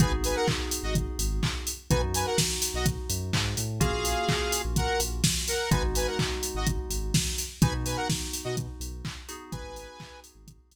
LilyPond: <<
  \new Staff \with { instrumentName = "Lead 2 (sawtooth)" } { \time 4/4 \key gis \minor \tempo 4 = 126 <b' gis''>16 r16 <b' gis''>16 <ais' fis''>16 r8. <fis' dis''>16 r2 | <b' gis''>16 r16 <b' gis''>16 <ais' fis''>16 r8. <fis' dis''>16 r2 | <gis' eis''>2 <ais' fis''>8 r4 <ais' fis''>8 | <b' gis''>16 r16 <b' gis''>16 <ais' fis''>16 r8. <fis' dis''>16 r2 |
<b' gis''>16 r16 <b' gis''>16 <ais' fis''>16 r8. <fis' dis''>16 r2 | <b' gis''>4. r2 r8 | }
  \new Staff \with { instrumentName = "Electric Piano 2" } { \time 4/4 \key gis \minor <b dis' fis' gis'>1 | <b dis' fis'>1 | <ais cis' eis' fis'>1 | <gis b dis' fis'>1 |
<b dis' fis'>2.~ <b dis' fis'>8 <b dis' fis' gis'>8~ | <b dis' fis' gis'>1 | }
  \new Staff \with { instrumentName = "Synth Bass 2" } { \clef bass \time 4/4 \key gis \minor gis,,16 gis,,4. gis,,8. gis,,4. | b,,16 fis,4. b,,8. fis,8 gis,8 a,8 | ais,,16 ais,,4. ais,,8. ais,,4. | gis,,16 gis,,4. gis,,8. gis,,4. |
b,,16 b,4. b,8. b,,4. | gis,,16 gis,,4. gis,,8. gis,,4. | }
  \new DrumStaff \with { instrumentName = "Drums" } \drummode { \time 4/4 <hh bd>8 hho8 <hc bd>8 hho8 <hh bd>8 hho8 <hc bd>8 hho8 | <hh bd>8 hho8 <bd sn>8 hho8 <hh bd>8 hho8 <hc bd>8 hho8 | <hh bd>8 hho8 <hc bd>8 hho8 <hh bd>8 hho8 <bd sn>8 hho8 | <hh bd>8 hho8 <hc bd>8 hho8 <hh bd>8 hho8 <bd sn>8 hho8 |
<hh bd>8 hho8 <bd sn>8 hho8 <hh bd>8 hho8 <hc bd>8 hho8 | <hh bd>8 hho8 <hc bd>8 hho8 <hh bd>8 hho8 r4 | }
>>